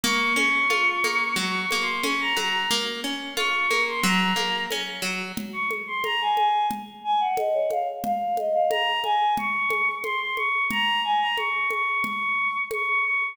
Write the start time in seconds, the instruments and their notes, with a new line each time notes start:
0.03 acoustic guitar (steel) A#3, choir aahs C#6, low conga
0.36 acoustic guitar (steel) C#4, choir aahs C#6, high conga
0.70 acoustic guitar (steel) F4, high conga
1.04 acoustic guitar (steel) A#3, high conga
1.36 acoustic guitar (steel) F#3, choir aahs C#6, low conga
1.60 choir aahs C#6
1.71 acoustic guitar (steel) A#3, high conga
1.81 choir aahs C6
2.03 acoustic guitar (steel) C#4, choir aahs C#6, high conga
2.20 choir aahs A#5
2.37 acoustic guitar (steel) F#3, choir aahs A#5, high conga
2.71 acoustic guitar (steel) A#3, low conga
3.04 acoustic guitar (steel) C#4
3.36 acoustic guitar (steel) F4, choir aahs C#6, high conga
3.71 acoustic guitar (steel) A#3, high conga
3.88 choir aahs C6
4.03 acoustic guitar (steel) F#3, choir aahs A#5, low conga
4.36 acoustic guitar (steel) A#3, high conga
4.71 acoustic guitar (steel) C#4, high conga
5.02 acoustic guitar (steel) F#3
5.37 low conga
5.53 choir aahs C#6
5.71 high conga
5.87 choir aahs C6
6.04 choir aahs A#5, high conga
6.21 choir aahs G#5
6.36 choir aahs G#5, high conga
6.71 low conga
7.04 choir aahs G#5
7.20 choir aahs F#5
7.37 choir aahs D#5, high conga
7.54 choir aahs C#5
7.70 choir aahs F5, high conga
8.04 choir aahs F5, low conga
8.37 choir aahs D#5, high conga
8.53 choir aahs F5
8.70 choir aahs A#5, high conga
9.04 choir aahs G#5, high conga
9.37 choir aahs C#6, low conga
9.70 high conga
10.03 choir aahs C6, high conga
10.20 choir aahs C6
10.36 choir aahs C#6, high conga
10.70 choir aahs A#5, low conga
11.04 choir aahs G#5
11.20 choir aahs A#5
11.37 choir aahs C#6, high conga
11.70 choir aahs C#6, high conga
12.03 choir aahs C#6, low conga
12.71 choir aahs C#6, high conga
12.87 choir aahs C#6
13.04 choir aahs C#6